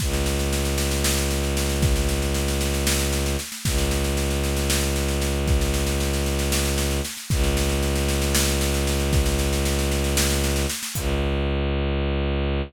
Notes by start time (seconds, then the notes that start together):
0.00 C#2, kick, snare
0.13 snare
0.26 snare
0.39 snare
0.52 snare
0.65 snare
0.78 snare
0.91 snare
1.04 snare
1.17 snare
1.31 snare
1.43 snare
1.57 snare
1.69 snare
1.82 kick, snare
1.96 snare
2.09 snare
2.22 snare
2.34 snare
2.48 snare
2.61 snare
2.74 snare
2.87 snare
3.00 snare
3.12 snare
3.26 snare
3.39 snare
3.52 snare
3.65 C#2, kick, snare
3.78 snare
3.91 snare
4.04 snare
4.17 snare
4.30 snare
4.44 snare
4.57 snare
4.70 snare
4.83 snare
4.96 snare
5.08 snare
5.22 snare
5.47 kick, snare
5.61 snare
5.74 snare
5.87 snare
6.00 snare
6.13 snare
6.26 snare
6.39 snare
6.52 snare
6.65 snare
6.78 snare
6.91 snare
7.05 snare
7.17 snare
7.30 C#2, kick, snare
7.44 snare
7.57 snare
7.69 snare
7.83 snare
7.96 snare
8.08 snare
8.22 snare
8.35 snare
8.48 snare
8.61 snare
8.74 snare
8.87 snare
9.00 snare
9.13 kick, snare
9.26 snare
9.39 snare
9.53 snare
9.65 snare
9.79 snare
9.92 snare
10.04 snare
10.17 snare
10.30 snare
10.44 snare
10.56 snare
10.70 snare
10.83 snare
10.95 C#2, kick, crash